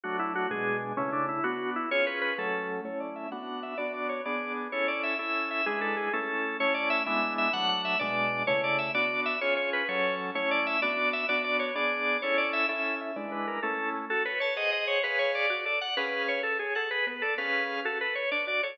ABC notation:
X:1
M:6/8
L:1/8
Q:3/8=128
K:A
V:1 name="Drawbar Organ"
F E F G2 z | C D E F2 E | c B B A3 | c d e f2 e |
d d c d2 z | c d e e2 e | G A G A3 | c d e e2 e |
f f e d3 | c d e d2 e | c c B c2 z | c d e d2 e |
d d c d3 | c d e e2 e | d B _B A2 z | [K:F#m] A B c ^d d c |
B c d d d f | B2 c A G A | B B A B2 z | A B c d d c |]
V:2 name="Drawbar Organ"
[F,A,D]3 [B,,G,D]3 | [C,A,E]3 [B,D]3 | [C^EG]3 [F,A,C]3 | [A,CE]3 [B,DF]3 |
[B,DF]3 [B,DG]3 | [CEA]3 [CEA]3 | [G,DEB]3 [A,CE]3 | [A,CE]3 [G,B,DE]3 |
[F,A,D]3 [B,,G,D]3 | [C,A,E]3 [B,DF]3 | [C^EG]3 [F,CA]3 | [A,CE]3 [B,DF]3 |
[B,DF]3 [B,DG]3 | [CEA]3 [CEA]3 | [G,DEB]3 [A,CE]3 | [K:F#m] F c a [G^Bf]3 |
[GBc^e]3 F A d | [CGB^e]3 z c f | G B, d [CGB^e]3 | F A z D F A |]